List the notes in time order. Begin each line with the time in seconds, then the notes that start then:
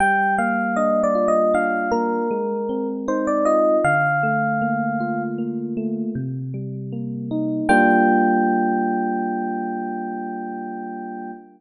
0.00 G3 G5
0.38 A#3 F5
0.76 D4 D#5
1.04 D5
1.15 F4
1.28 D#5
1.54 D4 F5
1.92 A#3 A#4
2.31 G#3
2.69 C4
3.08 D#4 C5
3.27 D5
3.45 F4 D#5
3.84 D3 F5
4.23 A3
4.62 A#3
5.00 F4
5.38 A#3
5.77 A3
6.15 C3
6.54 G3
6.92 A#3
7.31 D#4
7.69 G3 A#3 D4 F4 G5